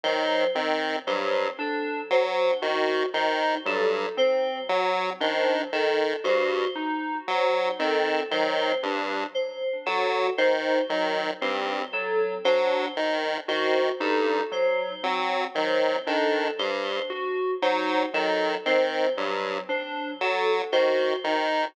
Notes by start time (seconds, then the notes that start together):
0.03 D#3 F#3 C5
0.55 D#3 C4
1.06 G2 F#3 C5
1.59 D4 A4
2.10 F#3 C5
2.62 D#3 F#4
3.14 D#3 D#4 C5
3.66 G2 F#3 A4
4.17 C4 C5
4.69 F#3
5.20 D#3 D4 C5
5.72 D#3 A4
6.24 G2 F#4 C5
6.75 D#4
7.28 F#3 C5
7.79 D#3 C4 A4
8.31 D#3 F#3 C5
8.83 G2 D4
9.34 C5
9.86 F#3 F#4 A4
10.38 D#3 D#4 C5
10.89 D#3 F#3
11.41 G2 C4 C5
11.92 F#3 A4
12.44 F#3 D4 C5
12.97 D#3
13.48 D#3 F#4 C5
14.00 G2 D#4 A4
14.52 F#3 C5
15.03 F#3 C4
15.55 D#3 F#3 C5
16.07 D#3 D4 A4
16.59 G2 C5
17.10 F#4
17.62 F#3 D#4 C5
18.14 D#3 F#3 A4
18.66 D#3 C4 C5
19.17 G2 F#3
19.69 D4 C5
20.20 F#3 A4
20.72 D#3 F#4 C5
21.24 D#3 D#4